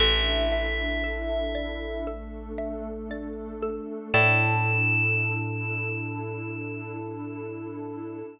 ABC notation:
X:1
M:4/4
L:1/8
Q:1/4=58
K:Amix
V:1 name="Tubular Bells"
e4 z4 | a8 |]
V:2 name="Xylophone"
A e A d A e d A | [Ade]8 |]
V:3 name="Electric Bass (finger)" clef=bass
A,,,8 | A,,8 |]
V:4 name="Pad 2 (warm)"
[DEA]4 [A,DA]4 | [DEA]8 |]